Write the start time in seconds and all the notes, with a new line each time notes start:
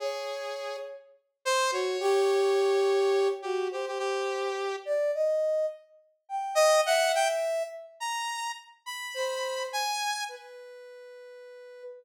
0.00 G#4 C#5
1.45 C5
1.71 F#4 C#5
2.00 G4
3.42 F#4 G4
3.71 G4 C5
3.88 G4
3.99 G4
4.85 D5
5.14 D#5
6.29 G5
6.55 D#5
6.86 E5 F#5
7.15 G5
8.00 A#5
8.86 B5
9.14 C5
9.73 G#5
10.29 B4